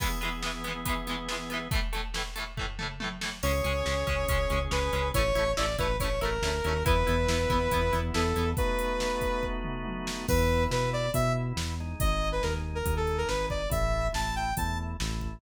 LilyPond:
<<
  \new Staff \with { instrumentName = "Lead 2 (sawtooth)" } { \time 4/4 \key e \major \tempo 4 = 140 r1 | r1 | cis''2. b'4 | cis''4 d''8 b'8 cis''8 ais'4. |
b'2. a'4 | b'2~ b'8 r4. | b'4 b'8 d''8 e''8 r4. | dis''8. b'16 ais'16 r8 bes'8 a'8 ais'16 b'8 d''8 |
e''4 a''8 g''8 a''8 r4. | }
  \new Staff \with { instrumentName = "Overdriven Guitar" } { \time 4/4 \key e \major <e gis b>8 <e gis b>8 <e gis b>8 <e gis b>8 <e gis b>8 <e gis b>8 <e gis b>8 <e gis b>8 | <a, e a>8 <a, e a>8 <a, e a>8 <a, e a>8 <a, e a>8 <a, e a>8 <a, e a>8 <a, e a>8 | <gis cis'>8 <gis cis'>8 <gis cis'>8 <gis cis'>8 <gis cis'>8 <gis cis'>8 <gis cis'>8 <gis cis'>8 | <a cis' e'>8 <a cis' e'>8 <a cis' e'>8 <a cis' e'>8 <a cis' e'>8 <a cis' e'>8 <a cis' e'>8 <a cis' e'>8 |
<b e'>8 <b e'>8 <b e'>8 <b e'>8 <b e'>8 <b e'>8 <b e'>8 <b e'>8 | r1 | r1 | r1 |
r1 | }
  \new Staff \with { instrumentName = "Drawbar Organ" } { \time 4/4 \key e \major <e b gis'>1 | r1 | <cis' gis'>1 | r1 |
<b e'>1 | <a b dis' fis'>1 | <b e'>2 <b e'>4. <gis dis'>8~ | <gis dis'>2 <gis dis'>2 |
<a e'>4 <a e'>4 <a e'>4 <a e'>4 | }
  \new Staff \with { instrumentName = "Synth Bass 1" } { \clef bass \time 4/4 \key e \major r1 | r1 | cis,8 cis,8 cis,8 cis,8 cis,8 cis,8 cis,8 cis,8 | a,,8 a,,8 a,,8 a,,8 a,,8 a,,8 d,8 dis,8 |
e,8 e,8 e,8 e,8 e,8 e,8 e,8 e,8 | r1 | e,4 b,4 b,4 e,4 | gis,,4 dis,4 dis,4 gis,,4 |
a,,4 a,,4 e,4 a,,4 | }
  \new DrumStaff \with { instrumentName = "Drums" } \drummode { \time 4/4 <cymc bd>8 hh8 sn8 hh8 <hh bd>8 hh8 sn8 hh8 | <hh bd>8 hh8 sn8 hh8 <bd tomfh>8 toml8 tommh8 sn8 | cymc8 hh8 sn8 <hh bd>8 <hh bd>8 hh8 sn8 hh8 | <hh bd>8 hh8 sn8 <hh bd>8 <hh bd>8 hh8 sn8 hh8 |
<hh bd>8 hh8 sn8 <hh bd>8 <hh bd>8 hh8 sn8 hh8 | <hh bd>8 hh8 sn8 <hh bd>8 bd8 toml8 tommh8 sn8 | <cymc bd>4 sn4 <hh bd>4 sn4 | <hh bd>4 sn4 <hh bd>8 hh8 sn8 bd8 |
<hh bd>4 sn4 <hh bd>4 sn8 bd8 | }
>>